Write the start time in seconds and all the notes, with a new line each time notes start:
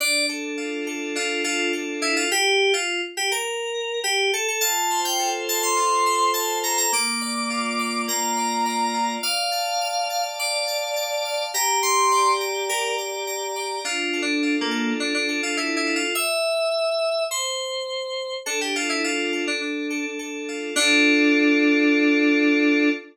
0.00 D4 D5
0.29 A4
0.57 F4
0.87 A4
1.15 D4 F4
1.44 F4 A4
1.73 A4
2.02 E4 F4
2.16 F4
2.31 G4
2.74 F4
3.17 G4
3.32 A#4
4.04 G4
4.33 A4
4.48 A4
4.61 F4 A5
4.90 C5
5.05 G5
5.19 A4
5.48 C5 A5
5.63 C6
5.77 F4
6.06 C5
6.34 C5 A5
6.63 A4 A#5
6.78 A#5
6.92 A#3 D6
7.21 D5
7.50 F4
7.79 D5
8.07 A#3 A#5
8.37 D5
8.66 D5
8.94 F4
9.23 D5 F5
9.52 A5
9.81 F5
10.10 A5
10.39 D5
10.67 A5
10.96 A5
11.25 F5
11.54 G4 A#5
11.83 A#5 C6
12.12 D5
12.41 A#5
12.69 G4 A#4
12.98 A#5
13.27 A#5
13.56 D5
13.84 D4 F4
14.13 A4
14.22 D4
14.43 F4
14.61 A#3
14.71 A4
15.00 D4
15.14 D4
15.28 A4
15.43 F4
15.57 E4 A4
15.76 E4
15.87 F4
15.96 F4
16.15 E5
17.31 C5
18.46 D4 A4
18.61 G4
18.75 F4 A4
18.89 E4
19.04 F4
19.33 A4
19.47 D4
19.61 D4
19.90 A4
20.19 A4
20.48 F4
20.76 D4 F4 A4